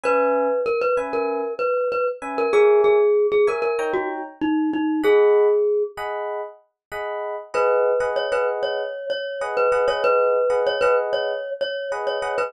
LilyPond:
<<
  \new Staff \with { instrumentName = "Glockenspiel" } { \time 4/4 \key gis \minor \tempo 4 = 96 b'4 ais'16 b'16 r16 ais'8. b'8 b'16 r8 ais'16 | gis'8 gis'8. gis'16 ais'16 ais'8 fis'16 r8 dis'8 dis'8 | gis'4. r2 r8 | b'4 cis''16 b'16 r16 cis''8. cis''8 r16 b'8 cis''16 |
b'4 cis''16 b'16 r16 cis''8. cis''8 r16 cis''8 b'16 | }
  \new Staff \with { instrumentName = "Electric Piano 1" } { \time 4/4 \key gis \minor <cis' b' e'' gis''>4. <cis' b' e'' gis''>2 <cis' b' e'' gis''>8 | <ais' cis'' e'' gis''>4. <ais' cis'' e'' gis''>8 <dis' cis'' g'' ais''>2 | <gis' dis'' fis'' b''>4. <gis' dis'' fis'' b''>4. <gis' dis'' fis'' b''>4 | <gis' b' dis'' fis''>8. <gis' b' dis'' fis''>8 <gis' b' dis'' fis''>4.~ <gis' b' dis'' fis''>16 <gis' b' dis'' fis''>8 <gis' b' dis'' fis''>16 <gis' b' dis'' fis''>16~ |
<gis' b' dis'' fis''>8. <gis' b' dis'' fis''>8 <gis' b' dis'' fis''>4.~ <gis' b' dis'' fis''>16 <gis' b' dis'' fis''>8 <gis' b' dis'' fis''>16 <gis' b' dis'' fis''>16 | }
>>